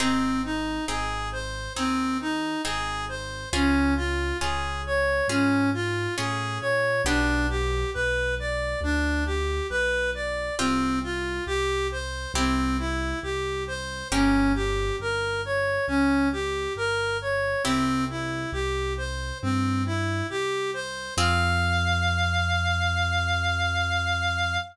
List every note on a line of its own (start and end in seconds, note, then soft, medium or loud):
0.00 0.79 G#1 loud
0.00 0.79 C4 medium
0.00 0.41 C4 medium
0.00 0.79 D#4 medium
0.00 0.79 G#4 loud
0.44 0.85 D#4 medium
0.88 1.68 G#1 medium
0.88 1.68 C4 medium
0.88 1.68 D#4 medium
0.88 1.29 G#4 medium
0.88 1.68 G#4 medium
1.32 1.73 C5 medium
1.76 2.56 D#2 medium
1.76 2.56 C4 medium
1.76 2.17 C4 medium
1.76 2.56 D#4 medium
1.76 2.56 G#4 medium
2.21 2.62 D#4 medium
2.64 3.45 G#1 medium
2.64 3.44 C4 medium
2.64 3.44 D#4 medium
2.64 3.05 G#4 medium
2.64 3.44 G#4 medium
3.09 3.49 C5 medium
3.53 4.32 C#2 medium
3.53 4.32 C#4 medium
3.53 3.94 C#4 medium
3.53 4.32 F4 medium
3.53 4.32 G#4 medium
3.97 4.37 F4 medium
4.41 5.21 C#2 medium
4.41 5.21 C#4 medium
4.41 5.21 F4 medium
4.41 4.82 G#4 medium
4.41 5.21 G#4 medium
4.86 5.27 C#5 medium
5.28 6.07 G#2 medium
5.28 5.70 C#4 medium
5.28 6.09 C#4 medium
5.28 6.09 F4 medium
5.28 6.09 G#4 medium
5.74 6.15 F4 medium
6.17 6.58 A2 medium
6.17 6.97 C#4 medium
6.17 6.97 F4 medium
6.17 6.58 G#4 medium
6.17 6.97 G#4 medium
6.61 7.02 A#2 medium
6.61 7.02 C#5 medium
7.05 7.84 B1 loud
7.05 10.24 B3 medium
7.05 10.24 D4 medium
7.05 7.47 D4 medium
7.05 10.24 G4 medium
7.50 7.90 G4 medium
7.94 8.75 B1 medium
7.94 8.35 B4 medium
8.39 8.80 D5 medium
8.81 9.60 D2 loud
8.81 9.24 D4 medium
9.26 9.67 G4 medium
9.70 10.50 B1 medium
9.70 10.10 B4 medium
10.15 10.55 D5 medium
10.59 11.40 C2 loud
10.59 10.99 C4 medium
10.59 12.18 C4 medium
10.59 12.18 F4 loud
10.59 12.18 G4 medium
11.03 11.44 F4 medium
11.47 12.26 C2 medium
11.47 11.87 G4 medium
11.92 12.32 C5 medium
12.34 13.13 C2 loud
12.34 13.94 C4 medium
12.34 12.77 C4 medium
12.34 13.94 E4 loud
12.34 13.94 G4 medium
12.79 13.19 E4 medium
13.23 14.03 C2 medium
13.23 13.64 G4 medium
13.67 14.08 C5 medium
14.12 14.91 G1 loud
14.12 17.29 A#3 medium
14.12 14.52 C#4 medium
14.12 17.29 C#4 medium
14.12 17.29 G4 loud
14.55 14.96 G4 medium
14.99 15.78 G1 medium
14.99 15.41 A#4 medium
15.45 15.86 C#5 medium
15.88 16.67 C#2 medium
15.88 16.28 C#4 medium
16.33 16.73 G4 medium
16.75 17.55 G1 medium
16.75 17.17 A#4 medium
17.22 17.62 C#5 medium
17.64 18.45 C2 loud
17.64 18.05 C4 medium
17.64 20.82 C4 medium
17.64 20.82 E4 medium
17.64 20.82 G4 medium
18.10 18.51 E4 medium
18.53 19.32 C2 medium
18.53 18.93 G4 medium
18.97 19.38 C5 medium
19.42 20.22 G2 medium
19.42 19.83 C4 medium
19.86 20.27 E4 medium
20.30 21.09 C2 medium
20.30 20.71 G4 medium
20.74 21.14 C5 medium
21.17 24.58 F2 loud
21.17 24.58 C4 loud
21.17 24.58 F4 loud
21.17 24.58 G#4 loud
21.17 24.58 F5 loud